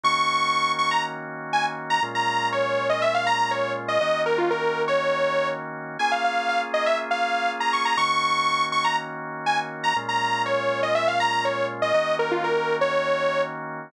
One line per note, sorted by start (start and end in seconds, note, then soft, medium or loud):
0.04 2.00 D#3 medium
0.04 2.00 A#3 medium
0.04 2.00 C#4 medium
0.04 2.00 F#4 loud
0.04 0.72 C#6 medium
0.79 0.90 C#6 medium
0.91 1.03 A#5 medium
1.53 1.65 G#5 medium
1.90 2.02 A#5 medium
2.03 3.99 A#2 loud
2.03 3.99 G#3 medium
2.03 3.99 C#4 medium
2.03 3.99 F4 medium
2.15 2.48 A#5 medium
2.52 2.88 C#5 medium
2.89 3.01 D#5 medium
3.02 3.14 E5 medium
3.14 3.26 F5 medium
3.27 3.38 A#5 medium
3.39 3.51 A#5 medium
3.51 3.72 C#5 medium
3.88 4.00 D#5 medium
4.01 5.97 D#3 medium
4.01 5.97 A#3 medium
4.01 5.97 C#4 medium
4.01 5.97 F#4 medium
4.01 4.21 D#5 medium
4.26 4.38 A#4 medium
4.38 4.50 F4 medium
4.51 4.82 A#4 medium
4.88 5.48 C#5 medium
5.99 7.96 A#3 medium
5.99 7.96 C#4 medium
5.99 7.96 F4 medium
5.99 7.96 G#4 loud
5.99 6.11 G#5 medium
6.12 6.23 F5 medium
6.24 6.48 F5 medium
6.49 6.61 F5 medium
6.74 6.85 D#5 medium
6.86 6.98 E5 medium
7.11 7.51 F5 medium
7.60 7.72 A#5 medium
7.73 7.85 C#6 medium
7.85 7.97 A#5 medium
7.97 9.93 D#3 medium
7.97 9.93 A#3 medium
7.97 9.93 C#4 medium
7.97 9.93 F#4 loud
7.97 8.65 C#6 medium
8.72 8.84 C#6 medium
8.85 8.96 A#5 medium
9.46 9.58 G#5 medium
9.84 9.95 A#5 medium
9.96 11.92 A#2 loud
9.96 11.92 G#3 medium
9.96 11.92 C#4 medium
9.96 11.92 F4 medium
10.09 10.42 A#5 medium
10.46 10.81 C#5 medium
10.83 10.95 D#5 medium
10.95 11.07 E5 medium
11.08 11.19 F5 medium
11.20 11.32 A#5 medium
11.32 11.44 A#5 medium
11.45 11.66 C#5 medium
11.82 11.94 D#5 medium
11.94 13.90 D#3 medium
11.94 13.90 A#3 medium
11.94 13.90 C#4 medium
11.94 13.90 F#4 medium
11.94 12.15 D#5 medium
12.19 12.31 A#4 medium
12.31 12.43 F4 medium
12.44 12.76 A#4 medium
12.81 13.42 C#5 medium